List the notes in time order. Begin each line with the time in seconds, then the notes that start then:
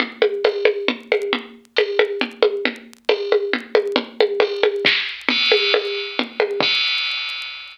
0.00 low conga
0.22 high conga
0.44 tambourine, high conga
0.65 high conga
0.88 low conga
1.12 high conga
1.33 low conga
1.76 tambourine, high conga
1.99 high conga
2.21 low conga
2.43 high conga
2.65 low conga
3.09 tambourine, high conga
3.32 high conga
3.53 low conga
3.75 high conga
3.96 low conga
4.20 high conga
4.40 tambourine, high conga
4.63 high conga
4.85 kick, snare
5.29 crash, low conga
5.52 high conga
5.74 tambourine, high conga
6.19 low conga
6.40 high conga
6.60 kick, crash